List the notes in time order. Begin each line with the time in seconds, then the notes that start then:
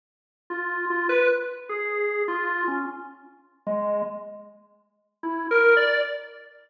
0.50 F4
0.90 F4
1.09 B4
1.69 G#4
2.28 F4
2.68 C#4
3.67 G#3
5.23 E4
5.51 A#4
5.77 D5